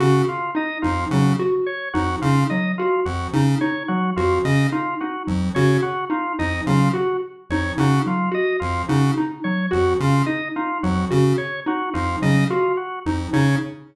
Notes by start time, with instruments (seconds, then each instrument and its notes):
0.00 lead 1 (square) C#3, drawbar organ F#4, xylophone F#4
0.28 drawbar organ F4
0.55 xylophone D#4, drawbar organ D#5
0.82 lead 1 (square) F2, xylophone D#4, drawbar organ F4
1.11 lead 1 (square) C#3, xylophone F#3, drawbar organ F#4
1.39 xylophone F#4
1.66 drawbar organ C#5
1.94 lead 1 (square) F2, xylophone D#4, drawbar organ F#4
2.22 lead 1 (square) C#3, xylophone D#4, drawbar organ F4
2.50 xylophone F#3, drawbar organ D#5
2.78 drawbar organ F4, xylophone F#4
3.05 lead 1 (square) F2, drawbar organ F#4
3.33 lead 1 (square) C#3, xylophone D#4
3.61 xylophone D#4, drawbar organ C#5
3.88 xylophone F#3, drawbar organ F#4
4.16 lead 1 (square) F2, drawbar organ F4, xylophone F#4
4.45 lead 1 (square) C#3, drawbar organ D#5
4.72 xylophone D#4, drawbar organ F4
5.00 xylophone D#4, drawbar organ F#4
5.27 lead 1 (square) F2, xylophone F#3
5.55 lead 1 (square) C#3, xylophone F#4, drawbar organ C#5
5.82 drawbar organ F#4
6.10 xylophone D#4, drawbar organ F4
6.39 lead 1 (square) F2, xylophone D#4, drawbar organ D#5
6.67 lead 1 (square) C#3, xylophone F#3, drawbar organ F4
6.93 xylophone F#4, drawbar organ F#4
7.50 lead 1 (square) F2, xylophone D#4, drawbar organ C#5
7.78 lead 1 (square) C#3, xylophone D#4, drawbar organ F#4
8.06 xylophone F#3, drawbar organ F4
8.32 xylophone F#4, drawbar organ D#5
8.60 lead 1 (square) F2, drawbar organ F4
8.89 lead 1 (square) C#3, xylophone D#4, drawbar organ F#4
9.18 xylophone D#4
9.44 xylophone F#3, drawbar organ C#5
9.71 lead 1 (square) F2, xylophone F#4, drawbar organ F#4
10.00 lead 1 (square) C#3, drawbar organ F4
10.26 xylophone D#4, drawbar organ D#5
10.56 xylophone D#4, drawbar organ F4
10.83 lead 1 (square) F2, xylophone F#3, drawbar organ F#4
11.11 lead 1 (square) C#3, xylophone F#4
11.38 drawbar organ C#5
11.66 xylophone D#4, drawbar organ F#4
11.94 lead 1 (square) F2, xylophone D#4, drawbar organ F4
12.22 lead 1 (square) C#3, xylophone F#3, drawbar organ D#5
12.50 drawbar organ F4, xylophone F#4
12.77 drawbar organ F#4
13.06 lead 1 (square) F2, xylophone D#4
13.33 lead 1 (square) C#3, xylophone D#4, drawbar organ C#5